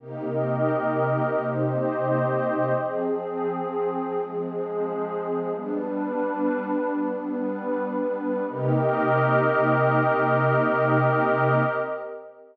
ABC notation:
X:1
M:4/4
L:1/8
Q:1/4=87
K:Cm
V:1 name="Pad 2 (warm)"
[C,B,EG]8 | [F,CA]8 | "^rit." [G,=B,D]8 | [C,B,EG]8 |]
V:2 name="Pad 2 (warm)"
[CGBe]4 [CGce]4 | [F,CA]4 [F,A,A]4 | "^rit." [G,D=B]4 [G,=B,B]4 | [CGBe]8 |]